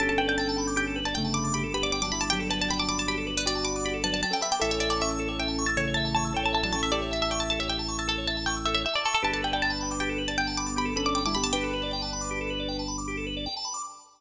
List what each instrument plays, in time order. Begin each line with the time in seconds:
0.00 drawbar organ G1 G4, acoustic grand piano C#4 A4, pizzicato strings A5
0.09 drawbar organ A4, pizzicato strings A5
0.18 drawbar organ B4, pizzicato strings G5
0.28 drawbar organ D5, pizzicato strings G5
0.38 drawbar organ G5, pizzicato strings A5
0.49 drawbar organ A5
0.58 drawbar organ B5
0.67 drawbar organ D6
0.76 drawbar organ G4, pizzicato strings G5
0.87 drawbar organ A4
0.96 drawbar organ B4
1.05 drawbar organ D5, pizzicato strings A5
1.14 acoustic grand piano C#3 A3, drawbar organ G5, pizzicato strings G5
1.24 drawbar organ A5
1.34 drawbar organ B5, pizzicato strings D6
1.44 drawbar organ D6
1.54 drawbar organ G4, pizzicato strings B5
1.64 drawbar organ A4
1.74 acoustic grand piano B3 G4, drawbar organ B4, pizzicato strings B5
1.83 drawbar organ D5, pizzicato strings D6
1.92 drawbar organ G5, pizzicato strings D6
2.02 acoustic grand piano F#3 D4, drawbar organ A5, pizzicato strings D6
2.12 acoustic grand piano G3 E4, pizzicato strings B5, drawbar organ B5
2.21 pizzicato strings A5, drawbar organ D6
2.30 acoustic grand piano F#3 D4, drawbar organ G4, pizzicato strings G5
2.39 drawbar organ A4
2.50 drawbar organ B4, pizzicato strings A5
2.61 drawbar organ D5, pizzicato strings A5
2.70 drawbar organ G5, pizzicato strings B5
2.79 drawbar organ A5, pizzicato strings D6
2.89 drawbar organ B5, pizzicato strings D6
2.98 pizzicato strings A5, drawbar organ D6
3.08 drawbar organ G4, pizzicato strings B5
3.17 drawbar organ A4
3.27 drawbar organ B4
3.37 pizzicato strings B4, drawbar organ D5
3.46 acoustic grand piano F#4 D5, pizzicato strings D5, drawbar organ G5
3.55 drawbar organ A5
3.64 drawbar organ B5, pizzicato strings D6
3.76 drawbar organ D6
3.85 drawbar organ G4, pizzicato strings B5
3.94 drawbar organ A4
4.04 acoustic grand piano F#3 D4, drawbar organ B4, pizzicato strings A5
4.12 drawbar organ D5, pizzicato strings A5
4.23 drawbar organ G5, pizzicato strings A5
4.31 acoustic grand piano C#4 A4, pizzicato strings G5, drawbar organ A5
4.41 acoustic grand piano B3 G4, pizzicato strings E5, drawbar organ B5
4.51 pizzicato strings G5, drawbar organ D6
4.60 drawbar organ A1 A4, acoustic grand piano C#4 A4, pizzicato strings E5
4.71 drawbar organ C#5, pizzicato strings E5
4.80 pizzicato strings D5, drawbar organ E5
4.90 pizzicato strings D5, drawbar organ A5
5.01 pizzicato strings E5, drawbar organ C#6
5.11 drawbar organ E6
5.19 drawbar organ A4
5.28 drawbar organ C#5
5.39 drawbar organ E5, pizzicato strings G5
5.48 drawbar organ A5
5.58 drawbar organ C#6
5.66 pizzicato strings A5, drawbar organ E6
5.77 acoustic grand piano C#3 A3, drawbar organ A4, pizzicato strings C#5
5.87 drawbar organ C#5
5.94 drawbar organ E5, pizzicato strings A5
6.05 drawbar organ A5
6.15 pizzicato strings A5, drawbar organ C#6
6.25 drawbar organ E6
6.34 acoustic grand piano C#4 A4, drawbar organ A4, pizzicato strings G5
6.43 drawbar organ C#5, pizzicato strings A5
6.53 drawbar organ E5, pizzicato strings A5
6.63 acoustic grand piano F#3 D4, drawbar organ A5, pizzicato strings A5
6.73 acoustic grand piano C#4 A4, pizzicato strings A5, drawbar organ C#6
6.83 pizzicato strings E5, drawbar organ E6
6.92 acoustic grand piano G4 E5, drawbar organ A4, pizzicato strings D5
7.02 drawbar organ C#5
7.11 drawbar organ E5, pizzicato strings E5
7.22 pizzicato strings E5, drawbar organ A5
7.31 pizzicato strings G5, drawbar organ C#6
7.40 pizzicato strings A5, drawbar organ E6
7.50 drawbar organ A4, pizzicato strings A5
7.59 drawbar organ C#5, pizzicato strings E5
7.68 drawbar organ E5, pizzicato strings G5
7.79 drawbar organ A5
7.88 drawbar organ C#6
7.99 pizzicato strings A5, drawbar organ E6
8.08 drawbar organ A4, pizzicato strings A4
8.18 drawbar organ C#5
8.27 drawbar organ E5, pizzicato strings A5
8.37 drawbar organ A5
8.46 pizzicato strings G5, drawbar organ C#6
8.56 drawbar organ E6
8.66 drawbar organ A4, pizzicato strings E5
8.74 drawbar organ C#5, pizzicato strings E5
8.86 drawbar organ E5, pizzicato strings E5
8.93 pizzicato strings D5, drawbar organ A5
9.05 pizzicato strings A4, drawbar organ C#6
9.14 pizzicato strings A4, drawbar organ E6
9.22 drawbar organ G1 G4, acoustic grand piano D4 B4, pizzicato strings A5
9.32 drawbar organ A4, pizzicato strings A5
9.42 drawbar organ B4, pizzicato strings G5
9.53 drawbar organ D5, pizzicato strings G5
9.62 drawbar organ G5, pizzicato strings A5
9.70 drawbar organ A5
9.81 drawbar organ B5
9.91 drawbar organ D6
10.00 drawbar organ G4, pizzicato strings G5
10.09 drawbar organ A4
10.18 drawbar organ B4
10.28 drawbar organ D5, pizzicato strings A5
10.37 acoustic grand piano D3 B3, pizzicato strings G5, drawbar organ G5
10.47 drawbar organ A5
10.57 drawbar organ B5, pizzicato strings D6
10.66 drawbar organ D6
10.77 drawbar organ G4, pizzicato strings B5
10.85 drawbar organ A4
10.96 acoustic grand piano C#4 A4, drawbar organ B4, pizzicato strings B5
11.05 drawbar organ D5, pizzicato strings D6
11.15 drawbar organ G5, pizzicato strings D6
11.26 acoustic grand piano G3 E4, drawbar organ A5, pizzicato strings D6
11.35 acoustic grand piano B3 G4, pizzicato strings B5, drawbar organ B5
11.43 pizzicato strings A5, drawbar organ D6
11.53 acoustic grand piano D4 B4, drawbar organ G4, pizzicato strings G5
11.63 drawbar organ A4
11.73 drawbar organ B4
11.83 drawbar organ D5
11.93 drawbar organ G5
12.02 drawbar organ A5
12.13 drawbar organ B5
12.21 drawbar organ D6
12.31 drawbar organ G4
12.41 drawbar organ A4
12.50 drawbar organ B4
12.60 drawbar organ D5
12.68 drawbar organ G5
12.79 drawbar organ A5
12.88 drawbar organ B5
12.98 drawbar organ D6
13.08 drawbar organ G4
13.17 drawbar organ A4
13.27 drawbar organ B4
13.37 drawbar organ D5
13.46 drawbar organ G5
13.57 drawbar organ A5
13.65 drawbar organ B5
13.74 drawbar organ D6